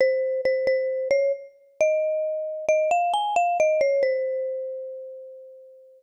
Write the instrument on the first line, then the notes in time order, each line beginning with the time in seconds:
marimba
0.01 C5
0.45 C5
0.67 C5
1.11 C#5
1.81 D#5
2.68 D#5
2.91 F5
3.14 G#5
3.36 F5
3.60 D#5
3.81 C#5
4.03 C5